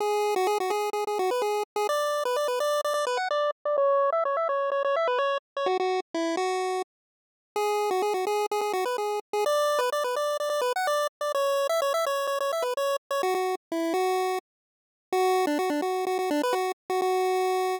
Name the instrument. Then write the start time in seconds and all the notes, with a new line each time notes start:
lead 1 (square)
0.00 G#4
0.36 F#4
0.47 G#4
0.60 F#4
0.70 G#4
0.93 G#4
1.07 G#4
1.19 F#4
1.31 B4
1.42 G#4
1.76 G#4
1.89 D5
2.25 B4
2.36 D5
2.48 B4
2.60 D5
2.84 D5
2.94 D5
3.07 B4
3.17 F#5
3.31 D5
3.65 D5
3.78 C#5
4.12 E5
4.25 C#5
4.37 E5
4.49 C#5
4.72 C#5
4.84 C#5
4.96 E5
5.07 B4
5.19 C#5
5.57 C#5
5.66 F#4
5.80 F#4
6.14 E4
6.37 F#4
7.56 G#4
7.91 F#4
8.02 G#4
8.14 F#4
8.27 G#4
8.51 G#4
8.61 G#4
8.73 F#4
8.85 B4
8.98 G#4
9.33 G#4
9.46 D5
9.79 B4
9.92 D5
10.04 B4
10.16 D5
10.40 D5
10.50 D5
10.61 B4
10.76 F#5
10.87 D5
11.21 D5
11.35 C#5
11.69 E5
11.82 C#5
11.94 E5
12.06 C#5
12.27 C#5
12.40 C#5
12.53 E5
12.62 B4
12.77 C#5
13.11 C#5
13.23 F#4
13.35 F#4
13.72 E4
13.94 F#4
15.12 F#4
15.47 D4
15.59 F#4
15.70 D4
15.82 F#4
16.07 F#4
16.19 F#4
16.31 D4
16.43 B4
16.53 F#4
16.90 F#4
17.02 F#4